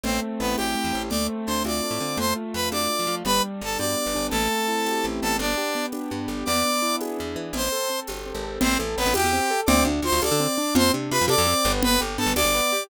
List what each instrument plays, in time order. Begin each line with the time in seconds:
0.03 electric bass (finger) A1, acoustic grand piano A3, brass section C4 C5, low conga
0.22 acoustic grand piano C4
0.40 electric bass (finger) A1, brass section B3 B4, acoustic grand piano E4
0.57 electric bass (finger) A1, brass section G4 G5, acoustic grand piano G4, tambourine, high conga
0.75 acoustic grand piano A3
0.84 electric bass (finger) E2
0.93 electric bass (finger) A1, acoustic grand piano C4
1.09 electric bass (finger) D2, acoustic grand piano A3, brass section D5 D6, low conga
1.29 acoustic grand piano C4
1.47 electric bass (finger) D2, acoustic grand piano D4, brass section C5 C6
1.64 electric bass (finger) D2, acoustic grand piano F4, brass section D5 D6, tambourine, high conga
1.83 acoustic grand piano A3
1.91 electric bass (finger) A2
2.00 electric bass (finger) D3, acoustic grand piano C4
2.17 electric bass (finger) F2, acoustic grand piano A3, brass section C5 C6, low conga
2.36 acoustic grand piano F4
2.54 electric bass (finger) F2, acoustic grand piano A3, brass section B4 B5
2.72 electric bass (finger) F2, acoustic grand piano D4, brass section D5 D6, tambourine, high conga
2.90 acoustic grand piano A3
2.99 electric bass (finger) F3
3.07 electric bass (finger) F3, acoustic grand piano F4
3.25 electric bass (finger) G1, acoustic grand piano G3, brass section B4 B5, low conga
3.43 acoustic grand piano D4
3.61 electric bass (finger) G1, acoustic grand piano G3, brass section A4 A5
3.78 electric bass (finger) G2, acoustic grand piano B3, brass section D5 D6, tambourine, high conga
3.97 acoustic grand piano G3
4.06 electric bass (finger) G1
4.14 electric bass (finger) G1, acoustic grand piano D4
4.30 electric bass (finger) A1, acoustic grand piano A3, brass section A4 A5, low conga
4.51 acoustic grand piano C4
4.68 acoustic grand piano E4
4.86 acoustic grand piano G4, tambourine, high conga
5.04 electric bass (finger) A1, acoustic grand piano A3
5.22 electric bass (finger) A1, acoustic grand piano B3, brass section A4 A5
5.39 electric bass (finger) G1, brass section D4 D5, low conga
5.57 acoustic grand piano G4
5.75 acoustic grand piano B3
5.92 acoustic grand piano D4, tambourine, high conga
6.11 electric bass (finger) G2, acoustic grand piano B3
6.28 electric bass (finger) G1, acoustic grand piano G4
6.45 electric bass (finger) E2, acoustic grand piano B3, brass section D5 D6, low conga
6.65 acoustic grand piano D4
6.82 acoustic grand piano E4
7.01 acoustic grand piano G#4, tambourine, high conga
7.18 electric bass (finger) E2, acoustic grand piano B3
7.36 electric bass (finger) E3, acoustic grand piano D4
7.53 electric bass (finger) A1, acoustic grand piano C4, brass section C5 C6, low conga
7.72 acoustic grand piano A4
7.90 acoustic grand piano C4
8.07 electric bass (finger) G1, acoustic grand piano G4, tambourine, high conga
8.26 acoustic grand piano C4
8.34 electric bass (finger) G#1
8.44 acoustic grand piano A4
8.61 electric bass (finger) A1, acoustic grand piano C4, brass section C4 C5, low conga
8.79 electric bass (finger) A1, acoustic grand piano A4
8.96 electric bass (finger) A1, brass section B3 B4, acoustic grand piano C4
9.06 electric bass (finger) A1
9.14 electric bass (finger) E2, acoustic grand piano G4, brass section G4 G5, tambourine, high conga
9.24 electric bass (finger) E2
9.33 acoustic grand piano C4
9.50 acoustic grand piano A4
9.66 electric bass (finger) D2, acoustic grand piano C4, brass section D5 D6, low conga
9.85 electric bass (finger) D2, acoustic grand piano D4
10.02 electric bass (finger) D2, acoustic grand piano F4, brass section C5 C6
10.12 electric bass (finger) D2
10.22 electric bass (finger) D2, acoustic grand piano A4, brass section D5 D6, tambourine, high conga
10.31 electric bass (finger) D3
10.40 acoustic grand piano C4
10.58 acoustic grand piano D4
10.75 electric bass (finger) F2, acoustic grand piano C4, brass section C5 C6, low conga
10.94 electric bass (finger) C3, acoustic grand piano D4
11.11 electric bass (finger) C3, acoustic grand piano F4, brass section B4 B5
11.21 electric bass (finger) F2
11.28 electric bass (finger) C3, acoustic grand piano A4, brass section D5 D6, tambourine, high conga
11.38 electric bass (finger) F2
11.47 acoustic grand piano C4
11.65 electric bass (finger) G1, acoustic grand piano B3
11.83 brass section B4 B5, low conga
12.00 electric bass (finger) G1, acoustic grand piano G4
12.18 electric bass (finger) G2, acoustic grand piano B3, brass section A4 A5
12.26 electric bass (finger) G1
12.35 electric bass (finger) D2, acoustic grand piano D4, brass section D5 D6, tambourine, high conga
12.45 electric bass (finger) G1
12.55 acoustic grand piano B3
12.72 acoustic grand piano G4